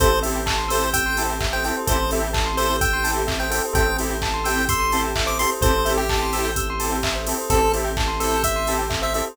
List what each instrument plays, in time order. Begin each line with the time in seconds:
0.00 synth bass 1 A1, lead 2 (sawtooth) C4 E4 G4 A4, string ensemble 1 C4 E4 G4 A4, tubular bells A4, lead 1 (square) C5, kick, closed hi-hat
0.11 tubular bells C5
0.23 lead 2 (sawtooth) C4 E4 G4 A4, tubular bells E5, open hi-hat
0.36 tubular bells G5
0.46 tubular bells A5, kick, clap
0.58 tubular bells C6
0.68 lead 2 (sawtooth) C4 E4 G4 A4, lead 1 (square) C5, tubular bells E6, open hi-hat
0.83 tubular bells G6
0.93 lead 1 (square) G5, tubular bells E6, kick, closed hi-hat
1.06 tubular bells C6
1.17 lead 2 (sawtooth) C4 E4 G4 A4, tubular bells A5, open hi-hat
1.30 tubular bells G5
1.41 tubular bells E5, kick, clap
1.53 tubular bells C5, lead 1 (square) G5
1.64 lead 2 (sawtooth) C4 E4 G4 A4, tubular bells A4, lead 1 (square) G5, open hi-hat
1.77 tubular bells C5
1.87 synth bass 1 A1, string ensemble 1 C4 E4 G4 A4, lead 2 (sawtooth) C4 E4 G4 A4, tubular bells A4, lead 1 (square) C5, kick, closed hi-hat
1.99 tubular bells C5
2.11 lead 2 (sawtooth) C4 E4 G4 A4, tubular bells E5, open hi-hat
2.21 tubular bells G5
2.33 tubular bells A5, kick, clap
2.46 tubular bells C6
2.57 lead 2 (sawtooth) C4 E4 G4 A4, lead 1 (square) C5, tubular bells E6, open hi-hat
2.68 tubular bells G6
2.81 lead 1 (square) G5, tubular bells E6, kick, closed hi-hat
2.93 tubular bells C6
3.04 lead 2 (sawtooth) C4 E4 G4 A4, tubular bells A5, open hi-hat
3.16 tubular bells G5
3.27 tubular bells E5, kick, clap
3.40 tubular bells C5, lead 1 (square) G5
3.50 lead 2 (sawtooth) C4 E4 G4 A4, tubular bells A4, lead 1 (square) G5, open hi-hat
3.65 tubular bells C5
3.73 synth bass 1 A1, lead 2 (sawtooth) C4 E4 G4 A4, string ensemble 1 C4 E4 G4 A4, tubular bells A4, lead 1 (square) G5, kick, closed hi-hat
3.87 tubular bells C5
3.98 lead 2 (sawtooth) C4 E4 G4 A4, tubular bells E5, open hi-hat
4.10 tubular bells G5
4.22 tubular bells A5, kick, clap
4.34 tubular bells C6
4.44 lead 2 (sawtooth) C4 E4 G4 A4, lead 1 (square) G5, tubular bells E6, open hi-hat
4.56 tubular bells G6
4.69 lead 1 (square) C6, tubular bells E6, kick, closed hi-hat
4.80 tubular bells C6
4.92 lead 2 (sawtooth) C4 E4 G4 A4, tubular bells A5, open hi-hat
5.04 tubular bells G5
5.16 tubular bells E5, kick, clap
5.26 tubular bells C5, lead 1 (square) D6
5.39 lead 2 (sawtooth) C4 E4 G4 A4, tubular bells A4, lead 1 (square) C6, open hi-hat
5.52 tubular bells C5
5.61 synth bass 1 A1, lead 2 (sawtooth) C4 E4 G4 A4, string ensemble 1 C4 E4 G4 A4, tubular bells A4, lead 1 (square) C5, kick, closed hi-hat
5.75 tubular bells C5
5.85 lead 2 (sawtooth) C4 E4 G4 A4, tubular bells E5, open hi-hat
5.97 lead 1 (square) G4, tubular bells G5
6.09 tubular bells A5, kick, clap
6.22 tubular bells C6
6.33 lead 2 (sawtooth) C4 E4 G4 A4, tubular bells E6, open hi-hat
6.45 tubular bells G6
6.56 tubular bells E6, kick, closed hi-hat
6.70 tubular bells C6
6.80 lead 2 (sawtooth) C4 E4 G4 A4, tubular bells A5, open hi-hat
6.92 tubular bells G5
7.03 tubular bells E5, kick, clap
7.15 tubular bells C5
7.26 lead 2 (sawtooth) C4 E4 G4 A4, tubular bells A4, open hi-hat
7.38 tubular bells C5
7.50 synth bass 1 A1, string ensemble 1 C4 E4 G4 A4, lead 2 (sawtooth) C4 E4 G4 A4, tubular bells A4, lead 1 (square) A4, kick, closed hi-hat
7.61 tubular bells C5
7.73 lead 2 (sawtooth) C4 E4 G4 A4, tubular bells E5, open hi-hat
7.84 tubular bells G5
7.97 tubular bells A5, kick, clap
8.08 tubular bells C6
8.20 lead 2 (sawtooth) C4 E4 G4 A4, lead 1 (square) A4, tubular bells E6, open hi-hat
8.31 tubular bells G6
8.43 lead 1 (square) E5, tubular bells E6, kick, closed hi-hat
8.56 tubular bells C6
8.67 lead 2 (sawtooth) C4 E4 G4 A4, tubular bells A5, open hi-hat
8.79 tubular bells G5
8.90 tubular bells E5, kick, clap
9.02 tubular bells C5, lead 1 (square) E5
9.14 lead 2 (sawtooth) C4 E4 G4 A4, tubular bells A4, lead 1 (square) E5, open hi-hat
9.27 tubular bells C5